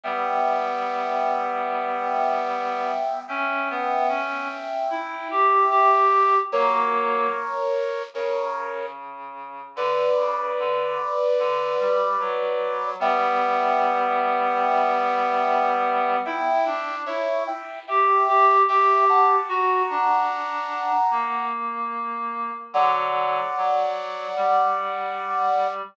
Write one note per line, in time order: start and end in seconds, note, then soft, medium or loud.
0.04 2.91 G3 medium
0.04 2.91 B3 medium
0.04 3.20 E5 medium
0.04 3.20 G5 medium
3.28 3.68 C#4 loud
3.28 6.34 E5 medium
3.28 6.34 G5 medium
3.70 4.07 B3 medium
4.08 4.48 C#4 medium
4.90 5.28 E4 medium
5.31 5.65 G4 medium
5.70 6.38 G4 medium
6.52 7.27 F#3 medium
6.52 7.27 A#3 loud
6.52 8.02 A#4 medium
6.52 8.02 C#5 medium
8.14 9.60 C#3 medium
8.14 8.86 A#4 medium
8.14 8.86 C#5 medium
9.76 10.08 D3 medium
9.76 12.90 B4 medium
9.76 12.90 D5 medium
10.17 10.51 C#3 medium
10.59 10.98 D3 medium
11.39 11.75 D3 medium
11.79 12.17 G3 medium
12.20 12.94 F#3 medium
12.99 16.17 G3 loud
12.99 16.17 B3 loud
12.99 16.16 E5 medium
12.99 16.16 G5 medium
16.25 16.65 E4 loud
16.25 16.95 E5 medium
16.25 16.95 G5 loud
16.66 17.05 D4 medium
17.06 17.47 E4 medium
17.06 17.44 C#5 medium
17.06 17.44 E5 medium
17.47 17.79 E5 medium
17.47 17.79 G5 medium
17.87 18.22 G4 medium
17.87 18.57 E5 medium
17.87 18.57 G5 medium
18.28 18.62 G4 loud
18.68 19.36 G4 medium
18.68 19.05 E5 medium
18.68 19.05 G5 medium
19.09 19.49 F#5 medium
19.09 19.49 A5 medium
19.49 19.82 F#4 loud
19.49 21.45 F#5 medium
19.49 21.45 A#5 medium
19.90 20.91 D4 medium
21.10 22.51 A#3 medium
22.73 23.41 D3 medium
22.73 23.41 F#3 loud
22.73 25.67 D5 medium
22.73 25.67 F#5 medium
23.57 24.27 F#3 medium
24.36 25.82 G3 medium